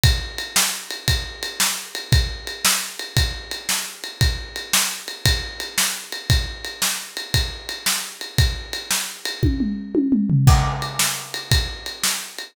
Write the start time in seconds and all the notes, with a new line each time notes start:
0.03 kick, ride
0.38 ride
0.56 snare
0.91 ride
1.08 kick, ride
1.43 ride
1.60 snare
1.95 ride
2.12 kick, ride
2.47 ride
2.65 snare
2.99 ride
3.17 kick, ride
3.51 ride
3.69 snare
4.04 ride
4.21 kick, ride
4.56 ride
4.73 snare
5.08 ride
5.26 kick, ride
5.60 ride
5.78 snare
6.12 ride
6.30 kick, ride
6.64 ride
6.82 snare
7.17 ride
7.34 kick, ride
7.69 ride
7.86 snare
8.21 ride
8.38 kick, ride
8.73 ride
8.91 snare
9.25 ride
9.43 kick, high tom
9.60 mid tom
9.95 high tom
10.12 mid tom
10.30 floor tom
10.47 kick, crash
10.82 ride
10.99 snare
11.34 ride
11.51 kick, ride
11.86 ride
12.03 snare
12.38 ride